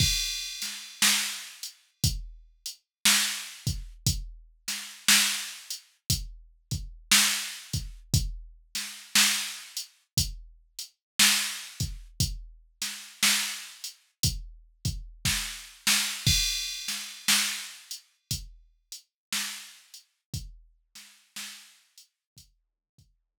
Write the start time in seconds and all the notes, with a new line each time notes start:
0.00 kick, crash
0.62 snare, closed hi-hat
1.02 snare
1.63 closed hi-hat
2.04 kick, closed hi-hat
2.66 closed hi-hat
3.05 snare
3.67 kick, closed hi-hat
4.07 kick, closed hi-hat
4.68 snare, closed hi-hat
5.08 snare
5.70 closed hi-hat
6.10 kick, closed hi-hat
6.71 kick, closed hi-hat
7.11 snare
7.73 kick, closed hi-hat
8.14 kick, closed hi-hat
8.75 snare, closed hi-hat
9.15 snare
9.77 closed hi-hat
10.17 kick, closed hi-hat
10.79 closed hi-hat
11.19 snare
11.80 kick, closed hi-hat
12.20 kick, closed hi-hat
12.82 snare, closed hi-hat
13.23 snare
13.84 closed hi-hat
14.23 kick, closed hi-hat
14.85 kick, closed hi-hat
15.25 kick, snare
15.87 snare
16.26 kick, crash
16.88 snare, closed hi-hat
17.28 snare
17.91 closed hi-hat
18.31 kick, closed hi-hat
18.92 closed hi-hat
19.32 snare
19.94 closed hi-hat
20.34 kick, closed hi-hat
20.95 snare, closed hi-hat
21.36 snare
21.98 closed hi-hat
22.37 kick, closed hi-hat
22.98 kick, closed hi-hat